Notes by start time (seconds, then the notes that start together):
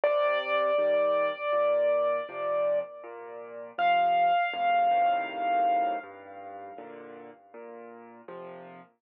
0.04 C3 D5
0.78 D#3 G3
1.53 A#2
2.29 C3 F3
3.04 A#2
3.78 C3 F3 F5
4.53 F2 A2 C3
4.91 F#2 A2 C3 D#3
6.03 G2
6.78 A#2 D3
7.54 A#2
8.28 C3 F3